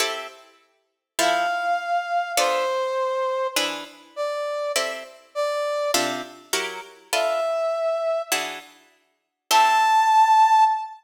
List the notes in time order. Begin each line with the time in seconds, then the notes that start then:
0.00 C4 E4 G4 A4
1.19 F3 E4 A4 C5 F5
2.37 B3 D4 F4 A4 C5
3.56 E3 D4 G#4 B4
4.16 D5
4.76 C4 E4 G4 A4
5.35 D5
5.94 C3 D4 F4 A4
6.53 F#3 E4 G4 A#4
7.13 D4 F4 A4 B4 E5
8.32 E3 D4 F#4 G#4
9.51 A3 C4 E4 G4 A5